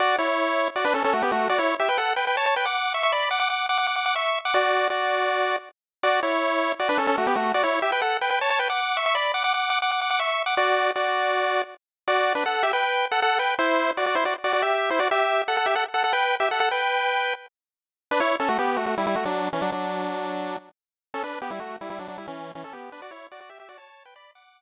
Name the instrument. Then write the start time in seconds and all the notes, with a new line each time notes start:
lead 1 (square)
0.00 F#4 D5
0.18 E4 C#5
0.76 F#4 D5
0.85 D4 B4
0.94 C#4 A4
1.04 C#4 A4
1.13 A3 F#4
1.22 B3 G4
1.32 A3 F#4
1.50 F#4 D5
1.59 E4 C#5
1.80 G4 E5
1.89 B4 G5
1.98 A4 F#5
2.16 B4 G5
2.27 B4 G5
2.37 C#5 A5
2.46 C#5 A5
2.56 B4 G5
2.65 F#5 D6
2.94 E5 C#6
3.03 E5 C#6
3.12 D5 B5
3.31 F#5 D6
3.40 F#5 D6
3.50 F#5 D6
3.69 F#5 D6
3.78 F#5 D6
3.87 F#5 D6
3.96 F#5 D6
4.06 F#5 D6
4.16 E5 C#6
4.45 F#5 D6
4.54 F#4 D5
4.90 F#4 D5
6.03 F#4 D5
6.23 E4 C#5
6.79 F#4 D5
6.89 D4 B4
6.98 C#4 A4
7.07 C#4 A4
7.18 A3 F#4
7.27 B3 G4
7.36 A3 F#4
7.54 F#4 D5
7.63 E4 C#5
7.82 G4 E5
7.92 B4 G5
8.02 A4 F#5
8.21 B4 G5
8.30 B4 G5
8.41 C#5 A5
8.50 C#5 A5
8.59 B4 G5
8.70 F#5 D6
8.97 E5 C#6
9.06 E5 C#6
9.15 D5 B5
9.34 F#5 D6
9.44 F#5 D6
9.54 F#5 D6
9.70 F#5 D6
9.82 F#5 D6
9.91 F#5 D6
10.01 F#5 D6
10.10 F#5 D6
10.19 E5 C#6
10.46 F#5 D6
10.57 F#4 D5
10.96 F#4 D5
12.08 F#4 D5
12.35 D4 B4
12.46 A4 F#5
12.63 G4 E5
12.73 B4 G5
13.11 A4 F#5
13.22 A4 F#5
13.39 B4 G5
13.59 E4 C5
13.97 F#4 D5
14.06 F#4 D5
14.15 E4 C5
14.25 F#4 D5
14.44 F#4 D5
14.53 F#4 D5
14.62 G4 E5
14.90 E4 C5
14.99 F#4 D5
15.11 G4 E5
15.48 A4 F#5
15.57 A4 F#5
15.66 G4 E5
15.75 A4 F#5
15.94 A4 F#5
16.04 A4 F#5
16.13 B4 G5
16.40 G4 E5
16.51 A4 F#5
16.60 A4 F#5
16.71 B4 G5
18.11 D4 B4
18.20 E4 C#5
18.40 C#4 A4
18.49 A3 F#4
18.59 B3 G4
18.77 A3 F#4
18.86 A3 F#4
18.98 G3 E4
19.07 G3 E4
19.16 A3 F#4
19.25 F#3 D4
19.53 E3 C#4
19.62 F#3 D4
19.72 F#3 D4
21.14 C#4 A4
21.24 D4 B4
21.42 B3 G4
21.51 G3 E4
21.60 A3 F#4
21.81 G3 E4
21.90 G3 E4
21.99 F#3 D4
22.08 F#3 D4
22.18 G3 E4
22.28 E3 C#4
22.55 E3 C#4
22.64 C#4 A4
22.73 B3 G4
22.92 D4 B4
23.02 F#4 D5
23.11 E4 C#5
23.32 F#4 D5
23.41 F#4 D5
23.50 G4 E5
23.60 G4 E5
23.69 F#4 D5
23.78 C#5 A5
24.05 B4 G5
24.16 D5 B5
24.35 F#5 D6